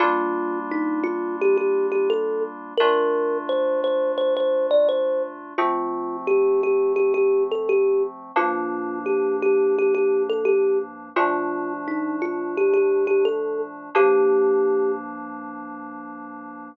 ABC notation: X:1
M:4/4
L:1/16
Q:1/4=86
K:Gm
V:1 name="Kalimba"
F4 E2 F2 G G2 G A2 z2 | B4 c2 c2 c c2 d c2 z2 | F4 G2 G2 G G2 A G2 z2 | F4 G2 G2 G G2 A G2 z2 |
F4 E2 F2 G G2 G A2 z2 | G6 z10 |]
V:2 name="Electric Piano 2"
[G,B,DF]16 | [B,,A,DF]16 | [F,A,C]16 | [G,,F,B,D]16 |
[B,,F,A,D]16 | [G,,F,B,D]16 |]